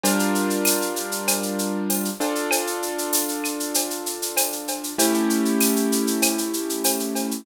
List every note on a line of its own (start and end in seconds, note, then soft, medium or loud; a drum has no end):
0.03 2.09 G3 medium
0.03 2.09 D4 medium
0.03 2.09 F4 medium
0.03 2.09 A#4 medium
0.03 cowbell medium
0.03 shaker loud
0.19 shaker medium
0.35 shaker medium
0.50 shaker medium
0.65 tambourine medium
0.65 claves medium
0.65 shaker loud
0.82 shaker medium
0.96 shaker medium
1.12 shaker medium
1.28 cowbell medium
1.28 claves medium
1.28 shaker loud
1.43 shaker medium
1.59 shaker medium
1.90 tambourine medium
1.90 cowbell medium
1.90 shaker medium
2.05 shaker medium
2.20 4.94 D4 medium
2.20 4.94 F4 medium
2.20 4.94 A4 medium
2.20 cowbell medium
2.20 shaker medium
2.35 shaker medium
2.51 cowbell medium
2.51 claves loud
2.51 shaker loud
2.67 shaker medium
2.82 shaker medium
2.98 shaker medium
3.13 tambourine medium
3.13 shaker loud
3.28 shaker medium
3.44 claves medium
3.44 shaker medium
3.60 shaker medium
3.74 cowbell medium
3.74 shaker loud
3.90 shaker medium
4.06 shaker medium
4.22 shaker medium
4.37 tambourine medium
4.37 cowbell medium
4.37 claves medium
4.37 shaker loud
4.52 shaker medium
4.68 cowbell medium
4.68 shaker medium
4.84 shaker medium
4.98 7.41 A3 medium
4.98 7.41 C#4 medium
4.98 7.41 E4 medium
4.98 7.41 G4 medium
4.98 cowbell loud
4.98 shaker loud
5.14 shaker medium
5.30 shaker medium
5.45 shaker medium
5.60 tambourine medium
5.60 claves medium
5.60 shaker loud
5.76 shaker medium
5.92 shaker medium
6.07 shaker medium
6.22 cowbell medium
6.22 claves loud
6.22 shaker loud
6.38 shaker medium
6.53 shaker medium
6.69 shaker medium
6.84 tambourine medium
6.84 cowbell medium
6.84 shaker loud
7.00 shaker medium
7.15 cowbell medium
7.15 shaker medium
7.31 shaker medium